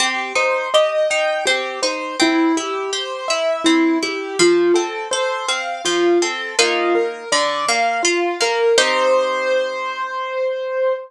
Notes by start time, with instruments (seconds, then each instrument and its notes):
0.00 orchestral harp C4, acoustic grand piano G4
0.35 orchestral harp D#4, acoustic grand piano C5
0.74 orchestral harp G4, acoustic grand piano D#5
1.10 orchestral harp D#4, acoustic grand piano G5
1.46 orchestral harp C4, acoustic grand piano G4
1.82 orchestral harp D#4, acoustic grand piano C5
2.20 orchestral harp C4, acoustic grand piano E4
2.57 orchestral harp E4, acoustic grand piano G4
2.93 orchestral harp G4, acoustic grand piano C5
3.28 orchestral harp E4, acoustic grand piano E5
3.64 orchestral harp C4, acoustic grand piano E4
4.03 orchestral harp E4, acoustic grand piano G4
4.39 orchestral harp F3, acoustic grand piano F4
4.74 orchestral harp C4, acoustic grand piano A4
5.11 orchestral harp A4, acoustic grand piano C5
5.48 orchestral harp C4, acoustic grand piano F5
5.85 orchestral harp F3, acoustic grand piano F4
6.22 orchestral harp C4, acoustic grand piano A4
6.59 orchestral harp A#3 D#4 F4, acoustic grand piano F4
6.95 acoustic grand piano A#4
7.32 orchestral harp D3, acoustic grand piano D5
7.68 orchestral harp A#3, acoustic grand piano F5
8.03 acoustic grand piano F4, orchestral harp F4
8.41 orchestral harp A#3, acoustic grand piano A#4
8.78 orchestral harp C4 D#4 G4, acoustic grand piano C5